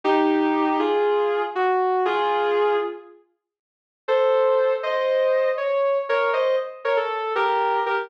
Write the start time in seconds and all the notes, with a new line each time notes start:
0.04 D#4 G4
0.79 F4 G#4
1.55 F#4
2.05 F4 G#4
4.08 A4 C5
4.83 C5 D#5
5.57 C#5
6.09 A#4 C#5
6.33 C5 D#5
6.85 A#4 C#5
6.97 A4
7.35 G4 A#4
7.86 G4 A#4